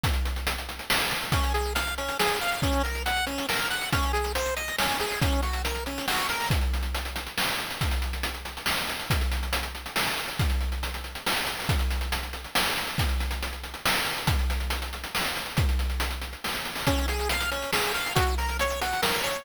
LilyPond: <<
  \new Staff \with { instrumentName = "Lead 1 (square)" } { \time 3/4 \key des \major \tempo 4 = 139 r2. | des'8 aes'8 f''8 des'8 aes'8 f''8 | des'8 bes'8 ges''8 des'8 bes'8 ges''8 | des'8 aes'8 c''8 ees''8 des'8 aes'8 |
des'8 ges'8 bes'8 des'8 ges'8 bes'8 | \key aes \major r2. | r2. | r2. |
r2. | r2. | r2. | r2. |
r2. | \key des \major des'8 aes'8 f''8 des'8 aes'8 f''8 | ges'8 bes'8 des''8 ges'8 bes'8 des''8 | }
  \new DrumStaff \with { instrumentName = "Drums" } \drummode { \time 3/4 <hh bd>16 hh16 hh16 hh16 hh16 hh16 hh16 hh16 sn16 hh16 hh16 hh16 | <hh bd>16 hh16 hh16 hh16 hh16 hh16 hh16 hh16 sn16 hh16 hh16 hh16 | <hh bd>16 hh16 hh16 hh16 hh16 hh16 hh16 hh16 sn16 hh16 hh16 hh16 | <hh bd>16 hh16 hh16 hh16 hh16 hh16 hh16 hh16 sn16 hh16 hh16 hh16 |
<hh bd>16 hh16 hh16 hh16 hh16 hh16 hh16 hh16 sn16 hh16 hh16 hho16 | <hh bd>16 hh16 hh16 hh16 hh16 hh16 hh16 hh16 sn16 hh16 hh16 hh16 | <hh bd>16 hh16 hh16 hh16 hh16 hh16 hh16 hh16 sn16 hh16 hh16 hh16 | <hh bd>16 hh16 hh16 hh16 hh16 hh16 hh16 hh16 sn16 hh16 hh16 hh16 |
<hh bd>16 hh16 hh16 hh16 hh16 hh16 hh16 hh16 sn16 hh16 hh16 hho16 | <hh bd>16 hh16 hh16 hh16 hh16 hh16 hh16 hh16 sn16 hh16 hh16 hh16 | <hh bd>16 hh16 hh16 hh16 hh16 hh16 hh16 hh16 sn16 hh16 hh16 hh16 | <hh bd>16 hh16 hh16 hh16 hh16 hh16 hh16 hh16 sn16 hh16 hh16 hh16 |
<hh bd>16 hh16 hh16 hh16 hh16 hh16 hh16 hh16 sn16 hh16 hh16 hho16 | <hh bd>16 hh16 hh16 hh16 hh16 hh16 hh16 hh16 sn16 hh16 hh16 hh16 | <hh bd>16 hh16 hh16 hh16 hh16 hh16 hh16 hh16 sn16 hh16 hh16 hh16 | }
>>